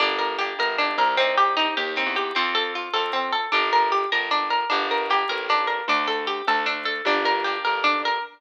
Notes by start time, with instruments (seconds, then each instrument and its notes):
0.00 electric bass (finger) G1, orchestral harp A#3 D4 G4, pizzicato strings D4
0.19 pizzicato strings A#4
0.39 orchestral harp A#3 D4 G4, pizzicato strings G4
0.59 electric bass (finger) G1, pizzicato strings A#4
0.78 orchestral harp A#3 D4 G4, pizzicato strings D4
0.98 electric bass (finger) C2, pizzicato strings A#4
1.17 pizzicato strings C4, orchestral harp C4 D#4 G4
1.38 pizzicato strings G4
1.57 orchestral harp C4 D#4 G4, pizzicato strings D#4
1.77 electric bass (finger) D#2, pizzicato strings G4
1.96 orchestral harp C4 D#4 G4, pizzicato strings C4
2.06 electric bass (finger) E2
2.16 pizzicato strings G4
2.35 electric bass (finger) F2, orchestral harp C4 F4 A4, pizzicato strings C4
2.55 pizzicato strings A4
2.75 pizzicato strings F4
2.93 electric bass (finger) F2, orchestral harp C4 F4 A4, pizzicato strings A4
3.13 pizzicato strings C4
3.33 pizzicato strings A4
3.52 electric bass (finger) G1, pizzicato strings D4, orchestral harp D4 G4 A#4
3.73 pizzicato strings A#4
3.92 pizzicato strings G4
4.12 electric bass (finger) G1, orchestral harp D4 G4 A#4, pizzicato strings A#4
4.31 pizzicato strings D4
4.50 pizzicato strings A#4
4.70 electric bass (finger) G1, orchestral harp A#3 D4 G4, pizzicato strings D4
4.91 pizzicato strings A#4
5.10 orchestral harp A#3 D4 G4, pizzicato strings G4
5.29 electric bass (finger) A1, pizzicato strings A#4
5.49 orchestral harp A#3 D4 G4, pizzicato strings D4
5.67 pizzicato strings A#4
5.88 electric bass (finger) D2, pizzicato strings D4
6.08 pizzicato strings A4
6.27 pizzicato strings G4
6.47 electric bass (finger) D2, pizzicato strings A4
6.66 pizzicato strings D4
6.85 pizzicato strings A4
7.05 electric bass (finger) G1, orchestral harp A#3 D4 G4, pizzicato strings D4
7.25 pizzicato strings A#4
7.44 orchestral harp A#3 D4 G4, pizzicato strings G4
7.65 electric bass (finger) G1, pizzicato strings A#4
7.84 pizzicato strings D4
8.05 pizzicato strings A#4